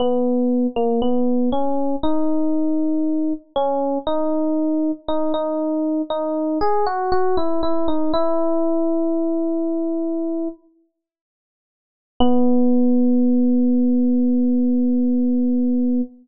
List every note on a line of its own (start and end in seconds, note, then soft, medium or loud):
0.00 0.67 B3 medium
0.76 1.00 A#3 medium
1.02 1.50 B3 medium
1.52 1.96 C#4 medium
2.03 3.33 D#4 medium
3.56 3.98 C#4 medium
4.07 4.91 D#4 medium
5.08 5.33 D#4 medium
5.34 6.02 D#4 medium
6.10 6.59 D#4 medium
6.61 6.85 G#4 medium
6.86 7.11 F#4 medium
7.12 7.36 F#4 medium
7.37 7.61 E4 medium
7.63 7.87 E4 medium
7.88 8.12 D#4 medium
8.14 10.48 E4 medium
12.20 16.01 B3 loud